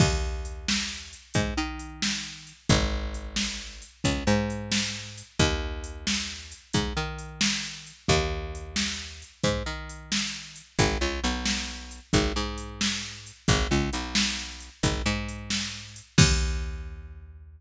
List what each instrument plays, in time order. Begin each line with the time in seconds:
0.00 electric bass (finger) D#2, kick, crash
0.45 closed hi-hat
0.68 snare
1.13 closed hi-hat
1.34 electric bass (finger) G#2, kick, closed hi-hat
1.57 electric bass (finger) D#3
1.79 closed hi-hat
2.02 snare
2.47 closed hi-hat
2.69 electric bass (finger) G#1, kick, closed hi-hat
3.14 closed hi-hat
3.36 snare
3.82 closed hi-hat
4.04 electric bass (finger) C#2, kick, closed hi-hat
4.27 electric bass (finger) G#2
4.50 closed hi-hat
4.72 snare
5.18 closed hi-hat
5.39 electric bass (finger) D#2, kick, closed hi-hat
5.84 closed hi-hat
6.07 snare
6.52 closed hi-hat
6.73 electric bass (finger) G#2, kick, closed hi-hat
6.97 electric bass (finger) D#3
7.19 closed hi-hat
7.41 snare
7.87 closed hi-hat
8.08 electric bass (finger) D#2, kick, closed hi-hat
8.55 closed hi-hat
8.76 snare
9.22 closed hi-hat
9.43 electric bass (finger) G#2, kick, closed hi-hat
9.66 electric bass (finger) D#3
9.89 closed hi-hat
10.12 snare
10.56 closed hi-hat
10.79 electric bass (finger) G#1, kick, closed hi-hat
11.01 electric bass (finger) C#2
11.24 electric bass (finger) B1, closed hi-hat
11.46 snare
11.91 closed hi-hat
12.13 electric bass (finger) G#1, kick, closed hi-hat
12.36 electric bass (finger) G#2
12.58 closed hi-hat
12.81 snare
13.26 closed hi-hat
13.48 electric bass (finger) G#1, kick, closed hi-hat
13.71 electric bass (finger) C#2
13.93 electric bass (finger) B1, closed hi-hat
14.15 snare
14.60 closed hi-hat
14.83 electric bass (finger) G#1, kick, closed hi-hat
15.06 electric bass (finger) G#2
15.29 closed hi-hat
15.50 snare
15.96 closed hi-hat
16.18 electric bass (finger) D#2, kick, crash